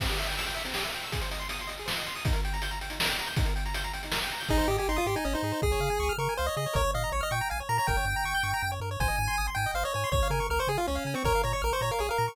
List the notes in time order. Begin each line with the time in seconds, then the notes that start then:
0.00 C4, kick, crash
0.09 G4, closed hi-hat
0.19 E5, closed hi-hat
0.27 G5, closed hi-hat
0.37 E6, closed hi-hat
0.46 G5, closed hi-hat
0.55 E5, closed hi-hat
0.65 C4, closed hi-hat
0.74 G4, snare
0.84 E5, closed hi-hat
0.93 G5, closed hi-hat
1.02 E6, closed hi-hat
1.12 G#4, kick, closed hi-hat
1.21 C5, closed hi-hat
1.31 D#5, closed hi-hat
1.40 C6, closed hi-hat
1.49 D#6, closed hi-hat
1.59 C6, closed hi-hat
1.67 D#5, closed hi-hat
1.78 G#4, closed hi-hat
1.86 C5, snare
1.96 D#5, closed hi-hat
2.06 C6, closed hi-hat
2.15 D#6, open hi-hat
2.25 D#4, kick, closed hi-hat
2.33 A#4, closed hi-hat
2.45 G5, closed hi-hat
2.53 A#5, closed hi-hat
2.62 G6, closed hi-hat
2.71 A#5, closed hi-hat
2.81 G5, closed hi-hat
2.90 D#4, closed hi-hat
3.00 A#4, snare
3.09 G5, closed hi-hat
3.19 A#5, closed hi-hat
3.27 G6, closed hi-hat
3.36 D#4, kick, closed hi-hat
3.45 A#4, closed hi-hat
3.56 G5, closed hi-hat
3.66 A#5, closed hi-hat
3.74 G6, closed hi-hat
3.84 A#5, closed hi-hat
3.93 G5, closed hi-hat
4.03 D#4, closed hi-hat
4.12 A#4, snare
4.22 G5, closed hi-hat
4.31 A#5, closed hi-hat
4.40 G6, open hi-hat
4.49 G#1 D#4 G#4, kick
4.58 C5
4.68 G#2 G4 D#5
4.78 G4 G#5
4.89 G#1 D#4 C6
4.96 F4 D#6
5.06 G#2 G4 C6
5.16 D#4 G#5
5.25 G#1 C#4 D#5
5.33 D#4 C5
5.43 G#2 G#4
5.52 C5
5.62 C#2 G#4, kick
5.72 C#5
5.80 C#3 F5
5.90 G#5
6.00 C#2 C#6
6.09 F6
6.18 C#3 A#4 C#6
6.29 G#5
6.37 C#2 C5 F5
6.46 C#5 D#5
6.57 C#3 G#4 D#5
6.66 C#5
6.73 A#1 A#4 C#5, kick
6.84 C#5
6.94 A#2 D#5 F5
7.04 A#5
7.12 A#1 C#5 C#6
7.21 D#5 F6
7.31 A#2 G5 C#6
7.41 A#5
7.50 A#1 F5 G#5
7.60 C#5
7.69 A#2 A#4 A#5
7.78 C#5 A#5
7.87 G1 A#4 G5, kick
7.97 C#5
8.05 G2 G5
8.16 A#5
8.24 G1 C#6
8.35 G6
8.43 G2 C#6
8.54 A#5
8.62 F#2 G5
8.72 C#5
8.80 G2 A#4
8.91 C#5
9.00 G#1 C5 G#5, kick
9.08 D#5
9.19 G#2 G#5
9.28 C6
9.38 G#1 D#6
9.47 C6
9.55 G#2 G5 G#5
9.66 D#5
9.74 G#1 C5 F5
9.83 C#5 D#5
9.94 G#2 C#5 G#5
10.04 C6
10.12 C#2 C#5, kick
10.23 F5
10.30 C#3 A#4 G#5
10.40 C#6
10.50 C#2 A#4 F6
10.59 C5 C#6
10.67 C#3 G#4 G#5
10.78 F4 F5
10.87 C#2 C#4 C#5
10.95 F5
11.05 C#3 G#5
11.14 C4 C#6
11.24 A#1 A#4 C#5, kick
11.35 F5
11.44 A#2 C#5 A#5
11.53 C#5 C#6
11.62 A#1 A#4 F6
11.73 C5 C#6
11.81 A#2 C#5 A#5
11.91 A#4 F5
11.99 A#1 G#4 C#5
12.09 A#4 F5
12.18 A#2 A#5
12.28 C#6